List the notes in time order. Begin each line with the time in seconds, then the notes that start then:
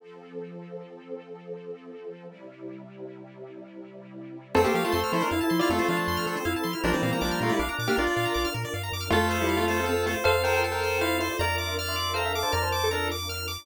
0.00 F3 C4 A4
2.28 C3 G3 E4
4.55 F2 A3 C4 F4 A4
4.64 A#3 G4 C5
4.74 F3 A#3 G4 F5
4.84 A3 F4 A5
4.92 F2 C4 A4 C6
5.04 F6
5.13 F3 E4 A4 C5
5.21 D4 A#4 C5
5.31 F2 E4 F5
5.41 E4 A5
5.50 F3 C6
5.59 E4 F4 D5 F6
5.70 F2 A3 C4 F4 A4
5.79 A3 F4 C5
5.88 F3 D4 F5
5.97 A5
6.08 F2 C6
6.17 F6
6.27 F3 A4
6.37 C5
6.45 F2 E4 F5
6.54 E4 A5
6.63 F3 C6
6.73 E4 F6
6.84 A#1 F3 G3 A#3 D4 F4 A#4
6.93 E3 C4 D5
7.02 A#2 E3 C4 F5
7.11 E3 C4 A#5
7.21 A#1 F3 D4 D6
7.31 F6
7.41 A#2 A3 F4 A#4
7.49 G3 E4 D5
7.59 A#1 D4 F5
7.69 D4 A#5
7.79 A#2 D6
7.88 A#3 D4 G4 F6
7.96 A#1 D4 F4 A#4 D5
8.07 D5
8.17 A#2 F5
8.25 A#5
8.34 A#1 D6
8.45 F6
8.54 A#2 A#4
8.65 D5
8.74 G2 F5
8.83 A#5
8.92 F#2 D6
9.01 F6
9.10 F2 A3 C4 F4 A4
9.31 C5
9.41 G3 E4
9.48 F5
9.57 A3 F4
9.68 A3 F4 C5
9.80 C4 A4
9.86 C4 A4
10.06 A3 F4 C5
10.24 F2 A4 C5 F5
10.44 A#4 C5 G5
10.54 A#4 G5
10.64 A4
10.72 A#4 G5
10.83 C5
11.01 E4 C5 F5
11.19 E4 C5
11.31 F4 D5
11.39 F2 D4 F4 A#4 D5 A#5
11.57 E5 C6 D6
11.67 E5 C6
11.77 D5 F6
11.88 E5 C6
11.96 D6
12.14 A4 C5 F5 A#5
12.25 E5
12.33 A4 E5 F5 D6
12.43 C5 A5
12.52 F2 A#4 D5 A#5 F6
12.62 C5 A5
12.72 D6
12.84 A4
12.91 D4 A#4 A#5
13.12 D6
13.29 F6
13.48 D6